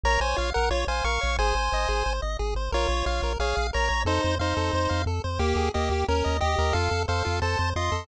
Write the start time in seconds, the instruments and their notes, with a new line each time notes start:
0.03 synth bass 1 A#1, lead 1 (square) A#4 C#5 A#5
0.20 synth bass 1 A#1, lead 1 (square) C5 C#5 G#5
0.36 synth bass 1 A#1, lead 1 (square) F4 C#5 F5
0.54 synth bass 1 A#1, lead 1 (square) A#4 F#5
0.70 synth bass 1 A#1, lead 1 (square) F4 C#5
0.87 synth bass 1 A#1, lead 1 (square) C5 F5 G#5
1.04 synth bass 1 A#1, lead 1 (square) A#4 F5 C#6
1.21 synth bass 1 A#1, lead 1 (square) C#5
1.39 synth bass 1 G#1, lead 1 (square) G#4 C5 G#5
1.55 synth bass 1 G#1, lead 1 (square) C5
1.72 synth bass 1 G#1, lead 1 (square) D#5
1.88 synth bass 1 G#1, lead 1 (square) G#4
2.06 synth bass 1 G#1, lead 1 (square) C5
2.22 synth bass 1 G#1, lead 1 (square) D#5
2.39 synth bass 1 G#1, lead 1 (square) G#4
2.55 synth bass 1 G#1, lead 1 (square) C5
2.72 synth bass 1 A#1, lead 1 (square) F4 A#4 C#5
2.89 synth bass 1 A#1, lead 1 (square) C#5
3.06 synth bass 1 A#1, lead 1 (square) F4 C#5 F5
3.22 synth bass 1 A#1, lead 1 (square) A#4
3.39 synth bass 1 A#1, lead 1 (square) G#4 C#5 F5
3.56 synth bass 1 A#1, lead 1 (square) F5
3.73 synth bass 1 A#1, lead 1 (square) A#4 C#5 A#5
3.89 synth bass 1 A#1, lead 1 (square) C#5
4.05 synth bass 1 F2, lead 1 (square) D#4 A4 C5
4.23 synth bass 1 F2, lead 1 (square) C5
4.39 synth bass 1 F2, lead 1 (square) D#4 C5 F5
4.57 synth bass 1 F2, lead 1 (square) A4
4.73 synth bass 1 F2, lead 1 (square) C5
4.89 synth bass 1 F2, lead 1 (square) F5
5.06 synth bass 1 F2, lead 1 (square) A4
5.24 synth bass 1 F2, lead 1 (square) C5
5.39 synth bass 1 D#2, lead 1 (square) A#3 G4
5.56 synth bass 1 D#2, lead 1 (square) G#4
5.74 synth bass 1 D#2, lead 1 (square) A#3 G4 D#5
5.90 synth bass 1 D#2, lead 1 (square) G4
6.08 synth bass 1 D#2, lead 1 (square) C#4 A#4
6.24 synth bass 1 D#2, lead 1 (square) D#5
6.40 synth bass 1 D#2, lead 1 (square) G4 D#5
6.58 synth bass 1 D#2, lead 1 (square) A#4
6.73 synth bass 1 F2, lead 1 (square) F4 A4 F5
6.91 synth bass 1 F2, lead 1 (square) A4
7.08 synth bass 1 F2, lead 1 (square) A4 C5 F5
7.25 synth bass 1 F2, lead 1 (square) F4
7.42 synth bass 1 F2, lead 1 (square) A4 C5 A5
7.59 synth bass 1 F2, lead 1 (square) C5
7.76 synth bass 1 F2, lead 1 (square) F4 D#5 C6
7.92 synth bass 1 F2, lead 1 (square) A4